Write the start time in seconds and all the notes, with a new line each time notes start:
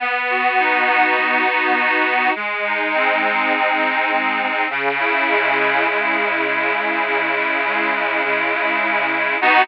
0.00 B3
0.30 F#4
0.59 D#4
0.89 F#4
1.18 B3
1.48 F#4
1.77 F#4
2.06 D#4
2.35 G#3
2.64 D#4
2.94 C4
3.23 D#4
3.53 G#3
3.82 D#4
4.11 D#4
4.41 C4
4.70 C#3
5.00 E4
5.29 G#3
5.59 E4
5.88 C#3
6.17 E4
6.47 E4
6.77 G#3
7.06 C#3
7.35 E4
7.65 G#3
7.94 E4
8.24 C#3
8.53 E4
8.82 E4
9.12 G#3
9.41 B3 D#4 F#4